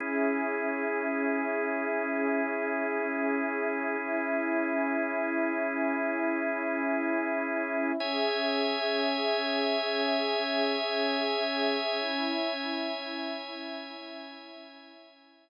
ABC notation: X:1
M:4/4
L:1/8
Q:1/4=60
K:C#dor
V:1 name="Drawbar Organ"
[CEG]8- | [CEG]8 | [ceg]8- | [ceg]8 |]
V:2 name="Pad 5 (bowed)"
[CGe]8 | [CEe]8 | [CGe]8 | [CEe]8 |]